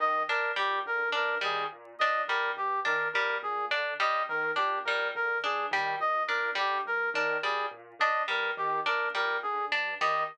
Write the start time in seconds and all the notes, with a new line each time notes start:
0.00 D#3 D#5
0.28 A#2 D4 A#4
0.56 A#2 G3 G4
0.85 D3 A#4
1.12 G2 D4 A#4
1.41 D#3 G3 G#4
1.72 A#2
1.99 A#2 D4 D#5
2.28 D3 G3 A#4
2.57 G2 G4
2.85 D#3 D4 A#4
3.13 A#2 G3 A#4
3.43 A#2 G#4
3.71 D3 D4
4.00 G2 G3 D#5
4.28 D#3 A#4
4.56 A#2 D4 G4
4.85 A#2 G3 A#4
5.15 D3 A#4
5.43 G2 D4 G#4
5.71 D#3 G3
5.99 A#2 D#5
6.27 A#2 D4 A#4
6.55 D3 G3 G4
6.85 G2 A#4
7.14 D#3 D4 A#4
7.42 A#2 G3 G#4
7.71 A#2
7.99 D3 D4 D#5
8.28 G2 G3 A#4
8.57 D#3 G4
8.86 A#2 D4 A#4
9.14 A#2 G3 A#4
9.42 D3 G#4
9.71 G2 D4
10.01 D#3 G3 D#5